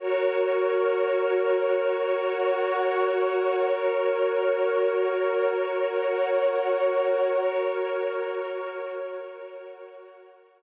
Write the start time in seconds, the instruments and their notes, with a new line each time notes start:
0.00 pad 5 (bowed) F#4 A#4 C#5, pad 2 (warm) F#4 A#4 C#5
1.85 pad 5 (bowed) F#4 C#5 F#5
3.69 pad 5 (bowed) F#4 A#4 C#5, pad 2 (warm) F#4 A#4 C#5
5.54 pad 5 (bowed) F#4 C#5 F#5
7.38 pad 5 (bowed) F#4 A#4 C#5, pad 2 (warm) F#4 A#4 C#5
9.24 pad 5 (bowed) F#4 C#5 F#5